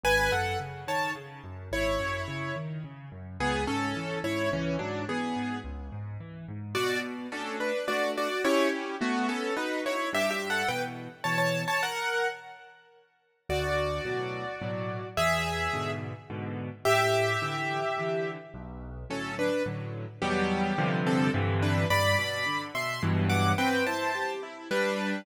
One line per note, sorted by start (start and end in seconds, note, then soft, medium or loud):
0.04 0.29 G#1 medium
0.04 0.31 B4 medium
0.04 0.31 G#5 loud
0.32 0.57 F#2 medium
0.32 0.58 A4 medium
0.32 0.58 F#5 medium
0.60 0.85 C#3 medium
0.88 1.13 D#3 medium
0.88 1.11 C#5 medium
0.88 1.11 A5 medium
1.16 1.41 C#3 medium
1.44 1.69 F#2 medium
1.72 1.97 G#1 medium
1.72 2.55 E4 medium
1.72 2.55 C#5 medium
2.00 2.25 F#2 medium
2.28 2.53 C#3 medium
2.56 2.81 D#3 medium
2.84 3.09 C#3 medium
3.12 3.37 F#2 medium
3.40 3.65 C#2 medium
3.40 3.64 B3 medium
3.40 3.64 G#4 loud
3.67 3.93 G#2 medium
3.67 4.18 C#4 medium
3.67 4.18 A4 medium
3.96 4.21 E3 medium
4.24 4.49 G#2 medium
4.24 4.49 E4 medium
4.24 4.49 C#5 medium
4.52 4.77 C#2 medium
4.52 4.76 E3 medium
4.52 4.76 C#4 medium
4.79 5.05 G#2 medium
4.79 5.05 F#3 medium
4.79 5.05 D4 medium
5.08 5.33 E3 medium
5.08 5.58 B3 medium
5.08 5.58 G#4 medium
5.36 5.61 G#2 medium
5.64 5.90 C#2 medium
5.92 6.18 G#2 medium
6.20 6.46 E3 medium
6.48 6.74 G#2 medium
6.75 7.27 B2 medium
6.75 6.99 F#4 medium
6.75 6.99 D5 loud
7.32 7.72 A3 medium
7.32 7.56 C#4 medium
7.32 7.72 D4 medium
7.32 7.72 F#4 medium
7.32 7.56 A4 medium
7.60 7.86 D4 medium
7.60 7.86 B4 medium
7.88 8.28 A3 medium
7.88 8.28 D4 medium
7.88 8.11 F#4 medium
7.88 8.11 D5 medium
8.18 8.43 F#4 medium
8.18 8.43 D5 medium
8.45 8.95 C#4 medium
8.45 8.68 E4 medium
8.45 8.95 E4 medium
8.45 8.95 G4 medium
8.45 8.68 C#5 loud
9.01 9.27 A3 medium
9.01 9.51 B3 medium
9.01 9.27 F#4 medium
9.29 9.54 C#4 medium
9.29 9.54 A4 medium
9.57 9.80 D#4 medium
9.57 9.96 D#4 medium
9.57 9.96 F#4 medium
9.57 9.80 B4 medium
9.86 10.09 E4 medium
9.86 10.09 C#5 medium
10.13 10.63 G2 loud
10.13 10.30 G4 medium
10.13 10.30 E5 loud
10.31 10.48 G4 medium
10.31 10.48 E5 medium
10.50 10.68 A4 medium
10.50 10.68 F#5 medium
10.68 11.08 B2 medium
10.68 11.08 E3 medium
10.68 10.82 B4 medium
10.68 10.82 G5 medium
11.24 11.64 B2 medium
11.24 11.64 E3 medium
11.24 11.37 C#5 medium
11.24 11.37 A5 medium
11.38 11.62 C#5 medium
11.38 11.62 A5 medium
11.68 11.81 C#5 medium
11.68 11.81 A5 medium
11.83 12.28 A#4 medium
11.83 12.28 F#5 medium
13.49 14.00 D2 medium
13.49 15.07 F#4 medium
13.49 15.07 D5 medium
14.05 14.45 A2 medium
14.05 14.45 B2 medium
14.05 14.45 F#3 medium
14.62 15.01 A2 medium
14.62 15.01 B2 medium
14.62 15.01 F#3 medium
15.17 15.68 E2 medium
15.17 15.90 G#4 medium
15.17 15.90 E5 loud
15.73 16.13 G#2 medium
15.73 16.13 B2 medium
15.73 16.13 D3 medium
16.30 16.69 G#2 medium
16.30 16.69 B2 medium
16.30 16.69 D3 medium
16.85 17.36 A2 medium
16.85 18.30 G4 loud
16.85 18.30 E5 loud
17.42 17.81 D3 medium
17.42 17.81 E3 medium
17.98 18.37 D3 medium
17.98 18.37 E3 medium
18.54 19.04 B1 medium
19.10 19.49 A2 medium
19.10 19.49 D3 medium
19.10 19.49 F#3 medium
19.10 19.35 C#4 medium
19.10 19.35 A4 medium
19.39 19.63 D4 medium
19.39 19.63 B4 medium
19.66 20.05 A2 medium
19.66 20.05 D3 medium
19.66 20.05 F#3 medium
20.22 20.73 E2 medium
20.22 20.73 B2 loud
20.22 20.73 F#3 medium
20.22 20.73 G3 loud
20.22 21.00 B3 medium
20.22 21.00 G4 medium
20.78 21.29 G2 loud
20.78 21.29 C3 loud
20.78 21.29 D3 loud
20.78 21.29 F3 loud
21.07 21.30 C4 medium
21.07 21.30 A4 medium
21.34 21.85 G2 loud
21.34 21.85 C3 loud
21.34 21.85 D3 loud
21.34 21.85 E3 loud
21.63 21.86 D4 medium
21.63 21.86 B4 medium
21.90 22.15 G2 medium
21.90 22.62 D5 medium
21.90 22.62 B5 loud
22.19 22.44 B2 medium
22.46 22.72 D3 medium
22.75 23.00 B2 medium
22.75 23.02 E5 medium
22.75 23.02 C6 medium
23.03 23.53 G2 loud
23.03 23.53 B2 loud
23.03 23.53 E3 medium
23.03 23.53 F#3 medium
23.30 23.52 F#5 medium
23.30 23.52 D6 medium
23.58 23.84 C4 loud
23.58 23.84 B4 medium
23.58 23.84 G5 medium
23.87 24.12 E4 medium
23.87 24.32 C5 medium
23.87 24.32 A5 medium
24.15 24.40 G4 medium
24.43 24.68 E4 medium
24.71 25.21 G3 loud
24.71 25.21 D4 loud
24.71 25.21 B4 loud